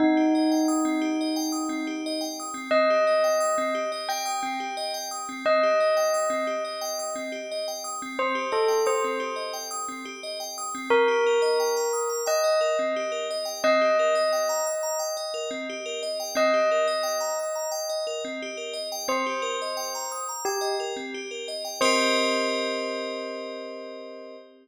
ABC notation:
X:1
M:4/4
L:1/16
Q:1/4=88
K:Cdor
V:1 name="Tubular Bells"
E16 | e8 g6 z2 | e16 | c2 A2 c4 z8 |
B8 e6 z2 | e16 | e16 | c8 G2 z6 |
c16 |]
V:2 name="Tubular Bells"
C G e g e' C G e g e' C G e g e' C | C G e g e' C G e g e' C G e g e' C | C G e g e' C G e g e' C G e g e' C | C G e g e' C G e g e' C G e g e' C |
C G B e g b e' b g e B C G B e g | C G B e g b e' b g e B C G B e g | C G B e g b e' b g e B C G B e g | C G B e g b e' b g e B C G B e g |
[CGBe]16 |]